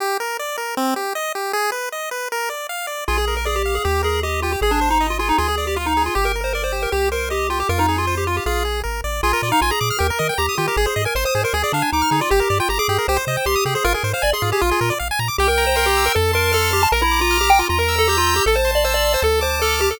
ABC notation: X:1
M:4/4
L:1/16
Q:1/4=156
K:Eb
V:1 name="Lead 1 (square)"
z16 | z16 | F A2 B A G2 A G2 A2 G2 F G | A D2 E2 F F E F A2 G F E2 F |
G B2 c B c2 B G2 B2 G2 F G | B E2 F2 G F G A4 z4 | F3 E F A3 B4 G2 F G | A A2 B c c2 B A2 D2 E2 E F |
G3 F G A3 c4 G2 A A | B B2 c d A2 G F4 z4 | [K:F] G B2 c B G2 B A2 B2 A2 G a | B E2 F2 G g F F B2 A G F2 G |
A c2 d c d2 c A2 c2 A2 G A |]
V:2 name="Lead 1 (square)"
G2 B2 d2 B2 C2 G2 e2 G2 | A2 _c2 e2 c2 B2 d2 f2 d2 | A2 B2 d2 f2 G2 B2 e2 G2 | A2 c2 e2 A2 A2 d2 f2 A2 |
G2 B2 d2 G2 G2 c2 e2 G2 | F2 A2 c2 F2 F2 A2 B2 d2 | A B d f a b d' f' G B e g b e' G B | A c e a c' e' A c A d f a d' f' A d |
G B d g b d' G B G c e g c' e' G c | F A c f a c' F A F A B d f a b d' | [K:F] g2 b2 c'2 e'2 a2 c'2 f'2 c'2 | b2 d'2 f'2 d'2 b2 e'2 g'2 e'2 |
a2 c'2 e'2 c'2 a2 d'2 f'2 d'2 |]
V:3 name="Synth Bass 1" clef=bass
z16 | z16 | B,,,8 E,,8 | A,,,8 D,,8 |
G,,,8 C,,8 | F,,8 B,,,4 A,,,2 =A,,,2 | B,,,2 B,,2 B,,,2 B,,2 E,,2 E,2 E,,2 E,2 | A,,,2 A,,2 A,,,2 A,,2 D,,2 D,2 D,,2 D,2 |
G,,,2 G,,2 G,,,2 G,,2 C,,2 C,2 C,,2 C,2 | A,,,2 A,,2 A,,,2 A,,2 B,,,2 B,,2 B,,,2 B,,2 | [K:F] C,,8 F,,8 | B,,,8 E,,8 |
A,,,8 D,,8 |]